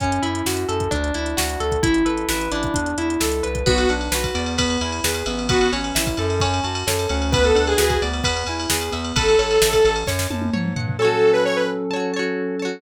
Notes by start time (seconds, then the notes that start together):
0.00 F#2 C#4, kick, closed hi-hat
0.12 closed hi-hat
0.22 F#2 E4, closed hi-hat
0.35 closed hi-hat
0.46 F#2 F#4, snare
0.57 closed hi-hat
0.68 F#2 A4, closed hi-hat
0.80 kick, closed hi-hat
0.91 D2 D4, kick, closed hi-hat
1.04 closed hi-hat
1.14 D2 E4, closed hi-hat
1.26 closed hi-hat
1.37 D2 F#4, snare
1.49 closed hi-hat
1.60 D2 A4, closed hi-hat
1.72 kick, closed hi-hat
1.82 A1 E4, kick, closed hi-hat
1.94 closed hi-hat
2.05 A1 A4 B4, closed hi-hat
2.17 closed hi-hat
2.29 A1 E4 B4, snare
2.41 closed hi-hat
2.52 A1 D4 E4, closed hi-hat
2.63 kick, closed hi-hat
2.74 E2 D4, kick, closed hi-hat
2.86 closed hi-hat
2.98 E2 E4, closed hi-hat
3.10 closed hi-hat
3.20 C#2 A4, snare
3.32 closed hi-hat
3.43 C2 B4, closed hi-hat
3.55 kick, closed hi-hat
3.66 B1 B3 F#4 B4, kick, crash
3.78 ride
3.89 B1 D4 F#5, ride
4.01 ride
4.12 B1 F#4 B4, snare
4.24 kick, ride
4.34 E2 B3 D5, ride
4.46 ride
4.58 B3 B4, kick, ride
4.70 ride
4.81 E2 E4 G#5, ride
4.92 ride
5.04 E2 G#4 B4, snare
5.14 ride
5.26 A1 B3 E5, ride
5.39 ride
5.49 B3 F#4 B4, kick, ride
5.61 ride
5.73 A1 C#4 C#5, ride
5.84 ride
5.95 A1 E4 E5, snare
6.07 kick, ride
6.17 F#2 A4 A5, ride
6.30 ride
6.40 C#4 C#5, kick, ride
6.54 ride
6.64 F#2 F#4 A5, ride
6.75 ride
6.87 F#2 A4 C#5, snare
6.99 ride
7.09 D2 C#4 F#5, ride
7.22 ride
7.32 B3 B4, kick, ride
7.44 A4, ride
7.55 D2 D4 F#5, ride
7.67 G#4, ride
7.77 D2 F#4 G#4 B4, snare
7.90 kick, ride
8.02 D2 B3 D5, ride
8.13 ride
8.23 E2 B3 B4, kick, ride
8.37 ride
8.47 E2 E4 G#5, ride
8.60 ride
8.70 E2 G#4 B4, snare
8.81 ride
8.91 E2 B3 E5, ride
9.04 ride
9.16 A1 A4 B4, kick, ride
9.28 ride
9.39 A1 C#5, ride
9.51 ride
9.62 A1 E5, snare
9.73 kick, ride
9.85 A1 A5, ride
9.96 ride
10.07 F#2 C#5, kick, snare
10.19 snare
10.30 F#2 A5, high tom
10.42 high tom
10.53 G#2 C#5, mid tom
10.65 mid tom
10.76 G2 F#5, floor tom
10.89 floor tom
10.99 F#3 C#4 A4 C#5 A5
11.05 F#4
11.33 B4
11.45 C#5
11.56 B4
11.91 C#5 A5
11.96 F#4
12.14 C#5 A5
12.19 F#4
12.59 C#5 A5
12.65 F#4